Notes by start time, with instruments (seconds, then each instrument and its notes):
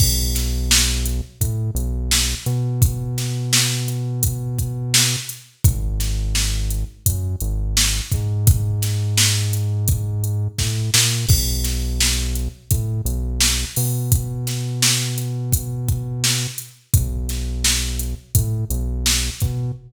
0.00 synth bass 1 B1, kick, crash
0.35 snare, closed hi-hat
0.71 snare
1.06 closed hi-hat
1.41 synth bass 1 A2, kick, closed hi-hat
1.75 synth bass 1 B1, closed hi-hat
2.11 snare
2.46 synth bass 1 B2, closed hi-hat
2.82 kick, closed hi-hat
3.18 snare, closed hi-hat
3.53 snare
3.88 closed hi-hat
4.23 kick, closed hi-hat
4.59 kick, closed hi-hat
4.94 snare
5.29 closed hi-hat
5.64 synth bass 1 G#1, kick, closed hi-hat
6.00 snare, closed hi-hat
6.35 snare
6.70 closed hi-hat
7.06 synth bass 1 F#2, kick, closed hi-hat
7.40 synth bass 1 G#1, closed hi-hat
7.77 snare
8.12 synth bass 1 G#2, kick, closed hi-hat
8.47 kick, closed hi-hat
8.82 snare, closed hi-hat
9.17 snare
9.53 closed hi-hat
9.88 kick, closed hi-hat
10.24 closed hi-hat
10.59 synth bass 1 A2, kick, snare
10.94 synth bass 1 A#2, snare
11.28 synth bass 1 B1, kick, crash
11.64 snare, closed hi-hat
12.00 snare
12.35 closed hi-hat
12.71 synth bass 1 A2, kick, closed hi-hat
13.05 synth bass 1 B1, closed hi-hat
13.41 snare
13.76 synth bass 1 B2, open hi-hat
14.12 kick, closed hi-hat
14.47 snare, closed hi-hat
14.82 snare
15.18 closed hi-hat
15.52 kick, closed hi-hat
15.88 kick, closed hi-hat
16.24 snare
16.58 closed hi-hat
16.94 synth bass 1 B1, kick, closed hi-hat
17.29 snare, closed hi-hat
17.64 snare
17.99 closed hi-hat
18.35 synth bass 1 A2, kick, closed hi-hat
18.70 synth bass 1 B1, closed hi-hat
19.06 snare
19.40 synth bass 1 B2, kick, closed hi-hat